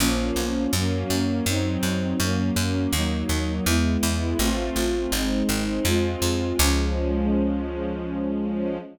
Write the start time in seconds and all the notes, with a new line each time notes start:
0.00 A#1 F3 A#3 C#4
0.36 B1
0.73 F#2 F#3 A#3 C#4
1.10 F#2
1.46 F#2 F#3 C4 D#4
1.83 F#2
2.20 F#2 F#3 A#3 C#4
2.56 F#2
2.93 D#2 F#3 A#3 D#4
3.29 D#2
3.66 E2 G#3 B3 E4
4.03 E2
4.39 A1 A3 C4 F4
4.76 A1
5.12 G#1 G#3 C4 D#4
5.49 G#1
5.85 F2 G#3 C4 F4
6.22 F2
6.58 C#2 F3 G#3 C#4